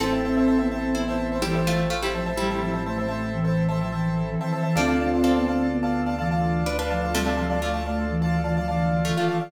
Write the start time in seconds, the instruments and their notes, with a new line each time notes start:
0.00 synth bass 1 A1, flute C4, pizzicato strings C4 A4, pad 5 (bowed) C4 E4 A4, marimba C4 E4 A4, acoustic grand piano C5 E5 A5
0.12 acoustic grand piano C5 E5 A5
0.24 flute C4, acoustic grand piano C5 E5 A5
0.37 acoustic grand piano C5 E5 A5
0.48 acoustic grand piano C5 E5 A5
0.59 flute B3, acoustic grand piano C5 E5 A5
0.72 flute C4, acoustic grand piano C5 E5 A5
0.95 flute B3, pizzicato strings E4 C5
1.08 acoustic grand piano C5 E5 A5
1.32 acoustic grand piano C5 E5 A5
1.42 flute E3, pizzicato strings G3 E4, acoustic grand piano C5 E5 A5
1.55 acoustic grand piano C5 E5 A5
1.67 pizzicato strings A3 F4
1.90 pizzicato strings A3 F4
2.02 pizzicato strings G3 E4, acoustic grand piano C5 E5 A5
2.14 flute F3, acoustic grand piano C5 E5 A5
2.26 acoustic grand piano C5 E5 A5
2.37 pizzicato strings G3 E4, flute G3
2.50 acoustic grand piano C5 E5 A5
2.62 flute F3, acoustic grand piano C5 E5 A5
2.73 acoustic grand piano C5 E5 A5
2.86 flute A3, acoustic grand piano C5 E5 A5
2.98 acoustic grand piano C5 E5 A5
3.08 flute A3, acoustic grand piano C5 E5 A5
3.33 flute E3
3.45 acoustic grand piano C5 E5 A5
3.69 flute E3, acoustic grand piano C5 E5 A5
3.81 flute F3, acoustic grand piano C5 E5 A5
3.92 flute E3, acoustic grand piano C5 E5 A5
4.28 flute E3
4.41 flute E3, acoustic grand piano C5 E5 A5
4.52 flute E3, acoustic grand piano C5 E5 A5
4.63 flute E3, acoustic grand piano C5 E5 A5
4.75 synth bass 1 D2, pizzicato strings F3 D4, flute C4, pad 5 (bowed) D4 F4 A4, marimba F4 A4, acoustic grand piano D5 F5 A5
4.80 marimba D4
4.88 acoustic grand piano D5 F5 A5
5.00 flute C4, acoustic grand piano D5 F5 A5
5.13 acoustic grand piano D5 F5 A5
5.23 pizzicato strings C4 A4, acoustic grand piano D5 F5 A5
5.36 flute B3, acoustic grand piano D5 F5 A5
5.48 flute C4, acoustic grand piano D5 F5 A5
5.72 flute B3
5.83 acoustic grand piano D5 F5 A5
6.06 acoustic grand piano D5 F5 A5
6.19 flute E3, acoustic grand piano D5 F5 A5
6.31 acoustic grand piano D5 F5 A5
6.66 pizzicato strings D4 B4
6.79 pizzicato strings D4 B4, acoustic grand piano D5 F5 A5
6.90 flute F3, acoustic grand piano D5 F5 A5
7.02 acoustic grand piano D5 F5 A5
7.14 pizzicato strings C3 A3, flute G3
7.26 acoustic grand piano D5 F5 A5
7.37 flute F3, acoustic grand piano D5 F5 A5
7.50 acoustic grand piano D5 F5 A5
7.62 flute A3, pizzicato strings A3 F4, acoustic grand piano D5 F5 A5
7.74 acoustic grand piano D5 F5 A5
7.86 flute A3, acoustic grand piano D5 F5 A5
8.10 flute E3
8.22 acoustic grand piano D5 F5 A5
8.44 flute E3, acoustic grand piano D5 F5 A5
8.57 flute F3, acoustic grand piano D5 F5 A5
8.68 flute E3, acoustic grand piano D5 F5 A5
9.05 flute E3, pizzicato strings A3 F4
9.17 flute E3, pizzicato strings A3 F4, acoustic grand piano D5 F5 A5
9.28 flute E3, acoustic grand piano D5 F5 A5
9.40 flute E3, acoustic grand piano D5 F5 A5